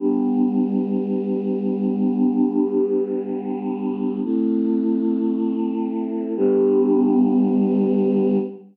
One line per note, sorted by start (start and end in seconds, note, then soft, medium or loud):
0.00 4.20 G3 medium
0.00 4.20 B3 medium
0.00 4.20 D4 medium
4.24 6.34 A3 medium
4.24 6.34 C4 medium
4.24 6.34 E4 medium
6.37 8.38 G3 loud
6.37 8.38 B3 loud
6.37 8.38 D4 loud